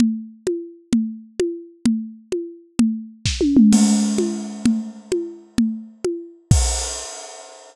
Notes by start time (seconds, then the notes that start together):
0.00 low conga
0.47 high conga
0.93 low conga
1.40 high conga
1.86 low conga
2.32 high conga
2.79 low conga
3.26 kick, snare
3.41 high tom
3.57 mid tom
3.72 crash, low conga
4.18 high conga
4.66 low conga
5.12 high conga
5.58 low conga
6.05 high conga
6.51 kick, crash